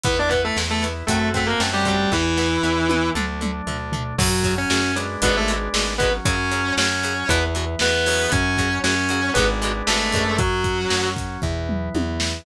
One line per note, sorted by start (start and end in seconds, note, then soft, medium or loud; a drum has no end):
0.03 0.51 E2 medium
0.03 0.15 E3 loud
0.03 1.05 B3 medium
0.03 0.17 B3 loud
0.03 0.15 B3 loud
0.03 1.05 E4 medium
0.03 0.17 B4 loud
0.03 kick loud
0.03 closed hi-hat medium
0.19 0.31 D4 medium
0.19 0.31 D5 medium
0.29 0.41 E3 medium
0.29 0.41 B3 medium
0.29 0.41 B4 medium
0.29 kick medium
0.29 closed hi-hat medium
0.44 0.57 A3 medium
0.44 0.57 A4 medium
0.57 1.03 E2 medium
0.57 0.67 E3 medium
0.57 0.67 B3 medium
0.57 snare medium
0.70 0.83 A3 medium
0.70 0.83 A4 medium
0.83 0.93 E3 medium
0.83 0.93 B3 medium
0.83 closed hi-hat medium
1.07 1.55 F#2 medium
1.07 1.19 F#3 loud
1.07 1.28 A3 medium
1.07 2.10 A3 medium
1.07 1.19 A3 medium
1.07 1.19 C4 loud
1.07 2.10 C4 medium
1.07 2.10 F#4 medium
1.07 1.28 A4 medium
1.07 kick medium
1.07 closed hi-hat loud
1.34 1.45 F#3 medium
1.34 1.45 A3 medium
1.34 1.49 A3 medium
1.34 1.45 C4 medium
1.34 1.49 A4 medium
1.34 kick medium
1.34 closed hi-hat medium
1.46 1.59 A#3 medium
1.46 1.59 A#4 medium
1.60 2.07 F#2 medium
1.60 1.70 F#3 medium
1.60 1.70 A3 medium
1.60 1.70 C4 medium
1.60 snare loud
1.73 1.85 G3 medium
1.73 1.85 G4 medium
1.85 1.96 F#3 medium
1.85 2.11 G3 medium
1.85 1.96 A3 medium
1.85 1.96 C4 medium
1.85 2.11 G4 medium
1.85 kick medium
1.85 closed hi-hat medium
2.11 2.58 E2 medium
2.11 2.22 E3 loud
2.11 3.09 E3 medium
2.11 3.13 B3 medium
2.11 2.22 B3 medium
2.11 3.13 E4 medium
2.11 3.09 E4 loud
2.11 kick medium
2.11 snare medium
2.37 2.48 E3 medium
2.37 2.48 B3 loud
2.37 snare medium
2.63 3.10 E2 medium
2.63 2.74 E3 medium
2.63 2.74 B3 medium
2.89 3.00 E3 medium
2.89 3.00 B3 medium
2.89 high tom medium
3.15 3.62 D2 medium
3.15 3.26 D3 loud
3.15 4.16 A3 medium
3.15 3.26 A3 loud
3.15 4.16 D4 medium
3.15 mid tom medium
3.41 3.51 D3 medium
3.41 3.51 A3 medium
3.41 mid tom medium
3.67 4.13 D2 medium
3.67 3.77 D3 medium
3.67 3.77 A3 medium
3.67 floor tom medium
3.92 4.03 D3 medium
3.92 4.03 A3 medium
3.92 floor tom loud
4.18 4.65 F#2 loud
4.18 4.29 C#3 loud
4.18 4.92 F#3 medium
4.18 4.51 F#3 loud
4.18 4.29 F#3 loud
4.18 4.92 C#4 medium
4.18 4.51 F#4 loud
4.18 kick loud
4.18 crash loud
4.44 4.55 C#3 medium
4.44 4.55 F#3 loud
4.44 kick medium
4.44 closed hi-hat medium
4.58 4.93 C#4 medium
4.58 4.93 C#5 loud
4.70 5.17 F#2 medium
4.70 4.81 C#3 loud
4.70 4.81 F#3 loud
4.70 snare loud
4.96 5.07 C#3 medium
4.96 5.07 F#3 medium
4.96 5.94 G#3 medium
4.96 5.94 B3 medium
4.96 5.94 D4 medium
4.96 closed hi-hat medium
5.22 5.69 G#1 loud
5.22 5.32 B2 loud
5.22 5.32 D3 loud
5.22 5.32 G#3 loud
5.22 5.35 B3 medium
5.22 5.35 B4 loud
5.22 kick medium
5.22 closed hi-hat loud
5.37 5.49 A3 medium
5.37 5.49 A4 loud
5.48 5.58 B2 medium
5.48 5.58 D3 medium
5.48 5.58 G#3 medium
5.48 closed hi-hat medium
5.74 6.20 G#1 medium
5.74 5.84 B2 medium
5.74 5.84 D3 medium
5.74 5.84 G#3 medium
5.74 snare loud
5.98 6.10 B2 loud
5.98 6.10 D3 medium
5.98 7.26 F#3 medium
5.98 6.10 G#3 loud
5.98 6.10 B3 medium
5.98 7.26 C#4 medium
5.98 6.10 B4 loud
5.98 kick medium
5.98 closed hi-hat medium
6.25 6.72 F#2 loud
6.25 6.36 C#3 loud
6.25 6.36 F#3 loud
6.25 6.73 C#4 loud
6.25 6.73 C#5 loud
6.25 kick loud
6.25 closed hi-hat loud
6.51 6.62 C#3 medium
6.51 6.62 F#3 medium
6.51 closed hi-hat medium
6.77 7.24 F#2 medium
6.77 6.88 C#3 loud
6.77 6.88 F#3 loud
6.77 7.28 C#4 medium
6.77 7.28 C#5 loud
6.77 snare loud
7.03 7.14 C#3 loud
7.03 7.14 F#3 medium
7.03 closed hi-hat medium
7.28 7.76 E2 loud
7.28 7.39 B2 loud
7.28 8.29 E3 medium
7.28 7.39 E3 loud
7.28 8.29 B3 medium
7.28 7.42 B3 loud
7.28 7.42 B4 loud
7.28 kick medium
7.28 closed hi-hat loud
7.55 7.65 B2 loud
7.55 7.65 E3 medium
7.55 closed hi-hat medium
7.79 8.27 E2 medium
7.79 7.91 B2 medium
7.79 7.91 E3 medium
7.79 8.31 B3 medium
7.79 8.31 B4 loud
7.79 snare loud
8.06 8.43 C#3 loud
8.06 8.43 F#3 loud
8.06 open hi-hat medium
8.32 8.79 F#2 loud
8.32 9.34 F#3 medium
8.32 8.77 C#4 loud
8.32 9.34 C#4 medium
8.32 8.77 C#5 loud
8.32 kick loud
8.32 closed hi-hat medium
8.57 8.69 C#3 loud
8.57 8.69 F#3 medium
8.57 kick medium
8.57 closed hi-hat medium
8.84 9.31 F#2 medium
8.84 8.95 C#3 medium
8.84 8.95 F#3 loud
8.84 9.31 C#4 medium
8.84 9.31 C#5 loud
8.84 snare loud
9.09 9.20 C#3 medium
9.09 9.20 F#3 loud
9.09 closed hi-hat medium
9.34 9.83 G#1 loud
9.34 9.46 D3 loud
9.34 10.37 G#3 medium
9.34 9.46 G#3 loud
9.34 9.46 B3 medium
9.34 10.37 B3 medium
9.34 10.37 D4 medium
9.34 9.46 B4 medium
9.34 kick medium
9.34 closed hi-hat medium
9.38 9.46 B2 loud
9.62 9.72 B2 loud
9.62 9.72 D3 medium
9.62 9.72 G#3 medium
9.62 closed hi-hat medium
9.87 10.12 G#1 medium
9.87 9.98 B2 medium
9.87 9.98 D3 loud
9.87 9.98 G#3 medium
9.87 10.36 A3 medium
9.87 10.36 A4 loud
9.87 snare loud
10.12 10.86 F#2 loud
10.12 10.24 B2 loud
10.12 10.24 D3 medium
10.12 10.24 G#3 medium
10.12 kick medium
10.12 closed hi-hat medium
10.38 11.06 F#3 loud
10.38 11.41 F#3 medium
10.38 11.41 C#4 medium
10.38 11.06 F#4 loud
10.38 kick loud
10.38 closed hi-hat medium
10.64 kick medium
10.64 closed hi-hat medium
10.90 11.38 F#2 medium
10.90 snare loud
11.16 kick medium
11.16 closed hi-hat medium
11.42 11.89 E2 medium
11.42 12.44 E3 medium
11.42 12.44 B3 medium
11.42 kick medium
11.42 floor tom medium
11.69 mid tom medium
11.95 12.41 E2 medium
11.95 high tom medium
12.20 snare loud